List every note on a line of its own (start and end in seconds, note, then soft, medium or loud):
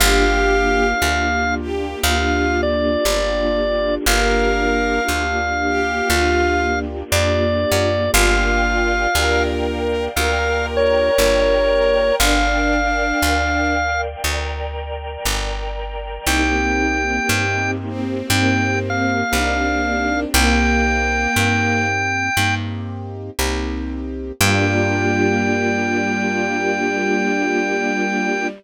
0.00 0.94 G1 loud
0.00 0.93 A#3 medium
0.00 4.04 A#3 medium
0.00 0.93 D4 medium
0.00 4.04 D4 medium
0.00 0.93 F4 medium
0.00 4.04 F4 medium
0.00 0.87 G4 loud
0.00 0.93 G4 medium
0.00 4.04 G4 medium
0.00 1.55 F5 loud
1.02 1.95 D2 medium
1.02 1.95 A#3 medium
1.02 1.95 D4 medium
1.02 1.95 F4 medium
1.02 1.95 G4 medium
1.61 1.99 G4 loud
2.03 2.97 D2 medium
2.03 2.97 A#3 medium
2.03 2.97 D4 medium
2.03 2.56 F4 loud
2.03 2.97 F4 medium
2.03 2.97 G4 medium
2.03 2.61 F5 loud
2.63 3.95 D5 loud
3.05 3.99 G1 medium
3.05 3.98 A#3 medium
3.05 3.98 D4 medium
3.05 3.98 F4 medium
3.05 3.98 G4 medium
4.06 5.00 G1 medium
4.06 5.00 A#3 medium
4.06 8.11 A#3 medium
4.06 5.00 D4 loud
4.06 8.11 D4 medium
4.06 5.00 F4 medium
4.06 8.11 F4 medium
4.06 5.00 G4 medium
4.06 8.11 G4 medium
4.06 5.02 A#4 loud
4.06 6.79 F5 loud
5.08 6.02 D2 medium
5.08 6.02 A#3 medium
5.08 6.02 D4 medium
5.08 6.02 F4 medium
5.08 6.02 G4 medium
5.68 6.08 G4 loud
6.10 7.03 D2 medium
6.10 7.03 A#3 medium
6.10 7.03 D4 medium
6.10 6.65 F4 loud
6.10 7.03 F4 medium
6.10 7.03 G4 medium
7.12 7.65 F2 medium
7.12 8.05 A#3 medium
7.12 8.05 D4 medium
7.12 8.05 F4 medium
7.12 8.05 G4 medium
7.12 8.11 D5 medium
7.72 8.10 F#2 medium
8.14 9.07 G1 loud
8.14 9.07 A#3 medium
8.14 9.07 D4 medium
8.14 9.06 F4 loud
8.14 9.07 F4 medium
8.14 9.07 G4 medium
8.14 10.15 A#4 medium
8.14 10.15 D5 medium
8.14 10.15 F5 medium
8.14 9.43 F5 loud
8.14 10.15 G5 medium
9.15 10.08 D2 medium
9.15 10.08 A#3 medium
9.15 10.08 D4 medium
9.15 10.08 F4 medium
9.15 10.08 G4 medium
9.15 10.03 A#4 loud
10.16 11.10 D2 medium
10.16 11.10 A#3 medium
10.16 11.10 D4 medium
10.16 11.10 F4 medium
10.16 11.10 G4 medium
10.16 12.19 A#4 medium
10.16 12.14 A#4 loud
10.16 12.19 D5 medium
10.16 10.66 F5 loud
10.16 12.19 G5 medium
10.16 12.19 A#5 medium
10.77 12.15 C#5 loud
11.18 12.12 G1 medium
11.18 12.12 A#3 medium
11.18 12.12 D4 medium
11.18 12.12 F4 medium
11.18 12.12 G4 medium
12.19 13.13 G1 medium
12.19 12.78 D4 loud
12.19 14.23 A#4 medium
12.19 14.23 D5 medium
12.19 14.01 F5 loud
12.19 14.23 F5 medium
12.19 14.23 G5 medium
12.80 13.73 D4 loud
13.22 14.16 D2 medium
14.23 15.17 D2 medium
14.23 16.25 A#4 medium
14.23 16.25 D5 medium
14.23 16.25 G5 medium
14.23 16.25 A#5 medium
15.25 16.19 G1 medium
16.26 17.20 C2 medium
16.26 18.28 A#3 medium
16.26 17.20 A#3 medium
16.26 18.28 C4 medium
16.26 17.20 C4 medium
16.26 18.28 D#4 medium
16.26 17.20 D#4 medium
16.26 18.28 G4 medium
16.26 17.20 G4 medium
16.26 17.71 G5 loud
17.29 18.22 G2 medium
17.29 18.22 A#3 medium
17.29 18.22 C4 medium
17.29 18.22 D#4 medium
17.29 18.22 G4 medium
17.88 19.11 C4 medium
18.30 19.23 G2 medium
18.30 20.32 A#3 medium
18.30 19.24 A#3 medium
18.30 20.32 C4 medium
18.30 19.24 C4 medium
18.30 19.24 D#4 medium
18.30 20.32 G4 medium
18.30 19.24 G4 medium
18.30 20.32 A#4 medium
18.30 18.79 G5 loud
18.90 20.20 F5 loud
19.32 20.26 C2 medium
19.32 20.25 A#3 medium
19.32 20.25 C4 medium
19.32 20.24 D4 medium
19.32 20.25 D#4 medium
19.32 20.25 G4 medium
20.34 21.27 C2 loud
20.34 21.27 A#3 medium
20.34 21.85 A#3 loud
20.34 21.27 C4 medium
20.34 21.27 D#4 medium
20.34 21.27 G4 medium
20.34 22.55 G5 loud
21.36 22.29 G2 medium
21.36 22.29 A#3 medium
21.36 22.29 C4 medium
21.36 22.29 D#4 medium
21.36 22.29 G4 medium
22.37 23.30 G2 medium
22.37 23.31 A#3 medium
22.37 23.31 C4 medium
22.37 23.31 D#4 medium
22.37 23.31 G4 medium
23.39 24.32 C2 medium
23.39 24.32 A#3 medium
23.39 24.32 C4 medium
23.39 24.32 D#4 medium
23.39 24.32 G4 medium
24.40 28.47 G2 loud
24.40 28.47 G3 loud
24.40 28.47 A#3 loud
24.40 28.47 D4 loud
24.40 28.47 F4 loud
24.40 28.47 F4 medium
24.40 28.47 G4 loud
24.40 28.47 G4 medium
24.40 28.47 G5 loud